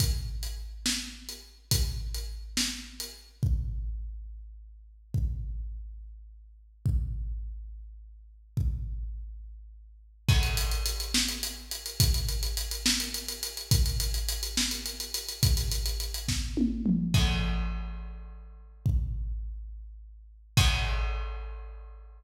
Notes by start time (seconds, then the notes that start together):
0.00 kick, closed hi-hat
0.43 closed hi-hat
0.86 snare
1.29 closed hi-hat
1.71 kick, closed hi-hat
2.14 closed hi-hat
2.57 snare
3.00 closed hi-hat
3.43 kick
5.14 kick
6.86 kick
8.57 kick
10.29 kick, crash
10.43 closed hi-hat
10.57 closed hi-hat
10.71 closed hi-hat
10.86 closed hi-hat
11.00 closed hi-hat
11.14 snare
11.29 closed hi-hat
11.43 closed hi-hat
11.71 closed hi-hat
11.86 closed hi-hat
12.00 kick, closed hi-hat
12.14 closed hi-hat
12.29 closed hi-hat
12.43 closed hi-hat
12.57 closed hi-hat
12.71 closed hi-hat
12.86 snare
13.00 closed hi-hat
13.14 closed hi-hat
13.28 closed hi-hat
13.43 closed hi-hat
13.57 closed hi-hat
13.71 kick, closed hi-hat
13.86 closed hi-hat
14.00 closed hi-hat
14.14 closed hi-hat
14.29 closed hi-hat
14.43 closed hi-hat
14.57 snare
14.71 closed hi-hat
14.86 closed hi-hat
15.00 closed hi-hat
15.14 closed hi-hat
15.29 closed hi-hat
15.43 kick, closed hi-hat
15.57 closed hi-hat
15.72 closed hi-hat
15.86 closed hi-hat
16.00 closed hi-hat
16.14 closed hi-hat
16.28 kick, snare
16.57 high tom
16.86 mid tom
17.14 kick, crash
18.86 kick
20.57 kick, crash